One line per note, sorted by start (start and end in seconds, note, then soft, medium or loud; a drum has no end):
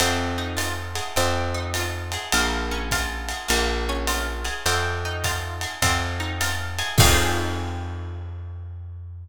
0.00 1.01 F2 medium
0.00 1.13 C4 medium
0.00 ride loud
0.38 1.13 D#4 medium
0.57 1.13 F4 medium
0.57 hi-hat pedal medium
0.57 ride medium
0.95 1.15 G#4 medium
0.95 ride medium
1.16 2.17 F2 medium
1.16 2.29 C4 medium
1.16 ride medium
1.54 2.30 D#4 medium
1.74 2.31 F4 medium
1.74 hi-hat pedal medium
1.74 ride medium
2.12 2.33 G#4 medium
2.12 ride medium
2.32 3.33 A#1 medium
2.32 3.46 A#3 medium
2.32 ride loud
2.71 3.47 C#4 medium
2.91 3.48 F4 medium
2.91 kick medium
2.91 hi-hat pedal medium
2.91 ride medium
3.29 3.50 G#4 medium
3.29 ride medium
3.48 4.50 A#1 medium
3.48 4.61 A#3 medium
3.48 ride medium
3.89 4.65 C#4 medium
4.07 4.64 F4 medium
4.07 hi-hat pedal medium
4.07 ride medium
4.45 4.64 G#4 medium
4.45 ride medium
4.66 5.66 F2 medium
4.66 5.78 C4 medium
4.66 ride medium
5.05 5.81 D#4 medium
5.24 5.80 F4 medium
5.24 kick medium
5.24 hi-hat pedal medium
5.24 ride medium
5.61 5.82 G#4 medium
5.61 ride medium
5.82 6.82 F2 medium
5.82 6.95 C4 medium
5.82 kick medium
5.82 ride loud
6.20 6.96 D#4 medium
6.41 6.97 F4 medium
6.41 hi-hat pedal medium
6.41 ride medium
6.79 6.98 G#4 medium
6.79 ride medium
6.98 9.28 F2 loud
6.98 9.28 C4 loud
6.98 9.28 D#4 loud
6.98 9.28 F4 medium
6.98 9.28 G#4 loud
6.98 kick loud
6.98 crash loud